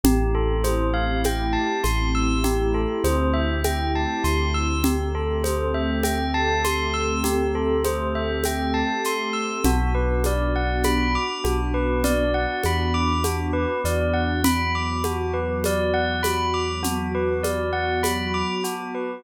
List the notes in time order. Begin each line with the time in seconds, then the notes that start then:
0.04 A1 A3 C4 E4 G4, low conga, shaker
0.35 A4
0.64 C5, high conga, shaker
0.94 F5
1.24 G5, high conga, shaker
1.53 A5
1.83 A1 C6, high conga, shaker
2.15 E6
2.44 G4, low conga, shaker
2.74 A4
3.04 D2 C5, high conga, shaker
3.33 E5
3.64 G5, high conga, shaker
3.95 A5
4.24 D2 C6, shaker
4.54 E6
4.84 A3 C4 G4 A4, low conga, shaker
5.15 A4
5.44 C5, high conga, shaker
5.74 E5
6.04 G5, high conga, shaker
6.34 A5
6.64 C6, high conga, shaker
6.94 E6
7.24 G4, low conga, shaker
7.55 A4
7.84 C5, high conga, shaker
8.15 E5
8.44 G5, high conga, shaker
8.74 A5
9.04 C6, shaker
9.33 E6
9.64 B1 B3 D4 F#4, low conga, shaker
9.95 B4
10.24 D5, high conga, shaker
10.55 F#5
10.84 B5, high conga, shaker
11.15 D6
11.44 B1 F#4, high conga, shaker
11.74 B4
12.04 D5, low conga, shaker
12.34 F#5
12.63 E2 B5, high conga, shaker
12.94 D6
13.24 F#4, high conga, shaker
13.53 B4
13.85 E2 D5, shaker
14.13 F#5
14.44 F#3 B3 F#4 B5, low conga, shaker
14.75 D6
15.04 F#4, high conga, shaker
15.34 B4
15.64 D5, high conga, shaker
15.94 F#5
16.23 B5, high conga, shaker
16.54 D6
16.83 F#4, low conga, shaker
17.14 B4
17.43 D5, high conga, shaker
17.73 F#5
18.03 B5, high conga, shaker
18.34 D6
18.64 F#4, shaker
18.95 B4